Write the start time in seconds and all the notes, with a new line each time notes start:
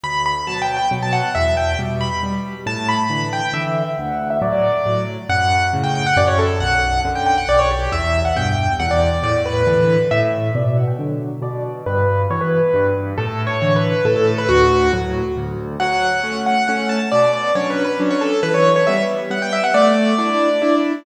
0.04 D2 B5
0.26 B5
0.47 B2 F#3 A5
0.62 G5
0.77 G5
0.91 B2 F#3
1.02 A5
1.13 F#5
1.35 E2 E5
1.57 G5
1.79 B2 G3
2.01 B5
2.23 B2 G3
2.66 A2 A5
2.89 B5
3.10 D3 E3
3.33 G5
3.53 D3 E3 E5
3.97 D2 F#5
4.30 E5
4.42 A2 F#3 D5
4.53 D5
4.86 A2 F#3
5.29 F#2 F#5
5.73 A2 C#3
5.84 G5
5.95 G5
6.06 F#5
6.17 F#2 D5
6.27 C#5
6.39 A4
6.60 B1 F#5
7.05 F#2 D3
7.15 G5
7.26 G5
7.38 F#5
7.48 B1 D5
7.59 C#5
7.71 G4
7.92 E2 E5
8.25 F#5
8.36 G2 B2 G5
8.80 E2 F#5
8.91 D5
9.23 A2 D5
9.46 B4
9.67 D3 E3
10.11 A2 E5
10.55 B2 D5
10.66 D5
10.77 F#5
10.87 G5
10.99 D3 F#3
11.42 B2 D5
11.86 G2 B4
12.30 B2 E3 C#5
12.41 B4
12.74 G2
13.18 A2 A4
13.47 C#5
13.62 D3 E3
13.76 B4
14.05 A2 A4
14.16 A4
14.27 A4
14.38 B4
14.49 D2 F#4
14.93 A2 F#3
15.37 D2
15.80 F#3 F#5
16.24 A3 C#4
16.46 F#5
16.68 A3 C#4 F#5
16.89 A5
17.12 B2 D5
17.33 D5
17.55 F#3 C#4 D4 C#5
17.70 B4
17.84 B4
18.00 F#3 C#4 D4
18.10 C#5
18.21 A4
18.43 E3 B4
18.54 C#5
18.76 C#5
18.87 G3 B3 E5
19.30 G3 B3 F#5
19.42 G5
19.53 E5
19.64 F#5
19.74 A3 D5
20.18 D4 E4
20.62 D4 E4